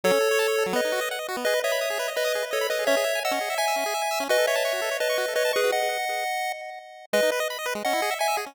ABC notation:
X:1
M:4/4
L:1/16
Q:1/4=169
K:E
V:1 name="Lead 1 (square)"
[Ac]8 [Bd]4 z4 | [Bd]2 [ce]6 [Bd]4 [Ac]2 [Bd]2 | [ce]4 [df]4 [eg]8 | [Bd]2 [ce]6 [Bd]4 [Bd]2 [GB]2 |
[df]10 z6 | [Bd]2 z6 [df]4 [eg]2 z2 |]
V:2 name="Lead 1 (square)"
F, C A c a c A F, B, D F d f d F B, | G B d b d' G B d b d' G B d b d' G | C G e g e' C G e g e' C G e g e' C | F A c a c' F A c a c' F A c a c' F |
z16 | G, D B d b d B G, C E G e g e G C |]